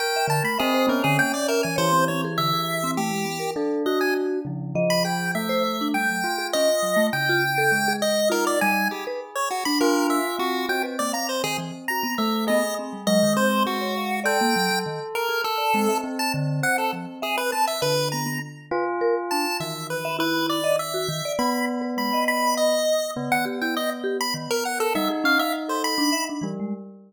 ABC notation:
X:1
M:6/8
L:1/16
Q:3/8=67
K:none
V:1 name="Lead 1 (square)"
g2 a b _A2 _B A g d B _a | c2 _d z e4 G4 | z2 _e _a z5 b g2 | e4 g4 _e4 |
g6 _e2 _B d _a2 | G z2 _d _G b _B2 e2 G2 | g z d _b c _A z2 b2 e2 | _e2 z2 e2 c2 _G4 |
g4 z2 _B2 A4 | z a z2 _g A z2 _A B =a e | B2 _b2 z6 a2 | e2 B2 B2 d2 e4 |
b2 z2 b2 b2 _e4 | z _g z =g _e z2 b z _B _g A | e z f e z c b3 z3 |]
V:2 name="Tubular Bells"
_B4 C2 _D6 | E,12 | D6 _D,2 F,4 | A,6 F6 |
_D,4 _A,4 _E4 | _A6 F6 | C10 A,2 | _A4 _A,4 A,4 |
A10 C2 | C12 | D,4 z2 F6 | _E,12 |
B,10 z2 | B,12 | _E10 G,2 |]
V:3 name="Vibraphone"
z e D, A, e c B, D, _B, z e E, | _d C C _A =D, A2 C =A, _A, B, _B | A2 _G4 F,2 _e2 _A2 | z c c D G, _G, z _A _D z G, =A, |
z F z A z _A z2 F2 G,2 | z B z3 D4 z C2 | _G B _B, f z _E, =E, z G =B, z2 | B, z C G, _G, _E, C3 _d f2 |
d _B, _G, G, _E, z2 _A z d _A, =e | z2 D,2 c2 F, z e z C z | B2 B, B, z2 B z _B z D z | E,3 e E3 _e z _G _E, d |
z3 B _A, _e7 | _D, _E, G =E z2 G z _E, z2 _B | G, _A _D f z =A2 =D e D E, _A, |]